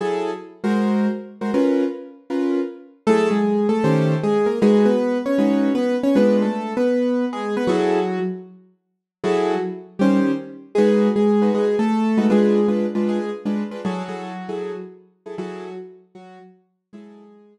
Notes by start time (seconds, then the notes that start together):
0.01 F#3 E4 G#4 A4
0.64 G#3 F#4 A#4 C5
1.41 G#3 F#4 A#4 C5
1.54 C#4 F4 A#4 B4
2.30 C#4 F4 A#4 B4
3.07 F#3 A3 E4 G#4 A4
3.31 G#3 G#4
3.69 A3 A4
3.84 D#3 C#4 G4 C5
4.23 G#3 G#4
4.46 A#3 A#4
4.62 G#3 D#4 F#4 G#4 B4
4.86 B3 B4
5.26 C#4 C#5
5.38 G#3 D#4 F#4 B4
5.75 B3 B4
6.03 C#4 C#5
6.15 G#3 B3 D4 F4 B4
6.42 A3 A4
6.77 B3 B4
7.33 G#3 G#4
7.57 B3 B4
7.67 F#3 E4 F#4 G#4 A4
9.24 F#3 E4 F#4 G#4 A4
9.99 D#3 G3 C#4 G4 C5
10.75 G#3 D#4 F#4 G#4 B4
11.16 G#3 G#4
11.42 G#3 D#4 F#4 B4
11.55 G#3 G#4
11.79 A3 A4
12.17 G#3 D#4 F#4 B4
12.30 G#3 D4 F4 G#4 B4
12.68 G#3 D4 F4 B4
12.95 G#3 D4 F4 B4
13.08 G#3 G#4
13.45 G#3 D4 F4 B4
13.71 G#3 D4 F4 B4
13.85 F#3 E4 F#4 G#4 A4
14.09 F#3 E4 G#4 A4
14.49 F#3 E4 G#4 A4
15.26 F#3 E4 G#4 A4
15.38 F#3 E4 F#4 G#4 A4
16.15 F#3 F#4
16.93 F#3 G#3 E4 G#4 A4
17.57 F#3 E4 G#4 A4